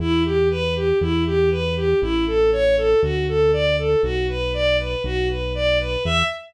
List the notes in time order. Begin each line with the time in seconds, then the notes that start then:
0.00 E2 E4
0.25 G4
0.51 B4
0.76 G4
1.01 E2 E4
1.26 G4
1.51 B4
1.76 G4
2.02 A1 E4
2.27 A4
2.52 C#5
2.77 A4
3.03 D2 F#4
3.28 A4
3.53 D5
3.78 A4
4.03 B1 F#4
4.29 B4
4.54 D5
4.79 B4
5.04 B1 F#4
5.29 B4
5.55 D5
5.80 B4
6.05 E2 E5